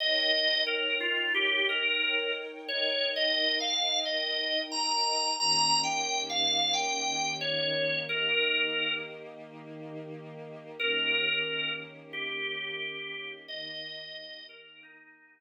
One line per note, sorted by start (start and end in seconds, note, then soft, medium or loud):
0.00 2.68 D#4 medium
0.00 2.68 A#4 loud
0.00 2.68 C#5 loud
0.00 0.62 D#5 medium
0.00 2.68 G5 medium
0.67 0.96 A#4 medium
1.00 1.33 F4 medium
1.34 1.65 G4 medium
1.69 2.32 A#4 medium
2.68 5.37 D#4 loud
2.68 5.37 A#4 loud
2.68 3.10 C#5 medium
2.68 5.37 D#5 loud
2.68 5.37 G5 medium
3.16 3.58 D#5 medium
3.60 3.99 F5 medium
4.05 4.60 D#5 medium
4.72 5.34 A#5 medium
5.39 8.06 D#3 loud
5.39 8.06 A#3 loud
5.39 8.06 C#4 medium
5.39 8.06 G4 loud
5.39 5.80 A#5 loud
5.83 6.21 G5 medium
6.30 6.73 F5 medium
6.73 7.33 G5 medium
7.41 7.96 C#5 medium
8.09 10.76 D#3 medium
8.09 10.76 A#3 loud
8.09 10.76 D#4 medium
8.09 10.76 G4 medium
8.09 8.92 A#4 medium
10.78 13.45 D#3 medium
10.78 13.45 A#3 medium
10.78 13.45 C#4 medium
10.78 13.45 G4 loud
10.78 11.72 A#4 medium
12.13 13.31 G4 medium
13.48 15.40 D#3 loud
13.48 15.40 A#3 loud
13.48 15.40 D#4 loud
13.48 15.40 G4 loud
13.48 14.45 D#5 loud
14.49 14.80 A#4 medium
14.83 15.40 D#4 medium